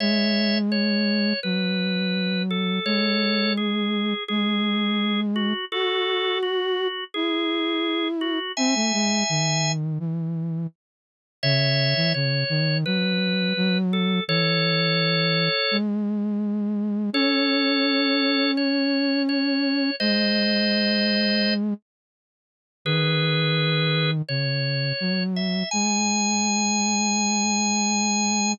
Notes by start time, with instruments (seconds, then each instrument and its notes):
0.00 flute G#3, drawbar organ C#5 E5
0.72 drawbar organ C#5
1.43 flute F#3, drawbar organ B4
2.50 drawbar organ A4
2.85 flute G#3, drawbar organ A4 C#5
3.57 drawbar organ G#4
4.28 flute G#3, drawbar organ G#4
5.36 drawbar organ F#4
5.72 drawbar organ F#4 A4, flute F#4
6.43 drawbar organ F#4
7.14 flute E4, drawbar organ G#4
8.21 drawbar organ F#4
8.57 flute C4, drawbar organ E5 G#5
8.75 flute A3
8.94 flute G#3
9.29 flute D#3
9.99 flute E3
11.43 flute C#3, drawbar organ C#5 E5
11.96 flute E3
12.14 flute C#3, drawbar organ C#5
12.49 flute D#3
12.86 flute F#3, drawbar organ B4
13.57 flute F#3
13.93 drawbar organ A4
14.28 flute E3, drawbar organ A4 C#5
15.71 flute G#3
17.13 flute C#4, drawbar organ A4 C#5
18.57 drawbar organ C#5
19.29 drawbar organ C#5
20.00 flute G#3, drawbar organ C5 D#5
22.85 flute D#3, drawbar organ G#4 B4
24.29 flute C#3, drawbar organ C#5
25.00 flute F#3
25.36 drawbar organ E5
25.71 flute G#3, drawbar organ G#5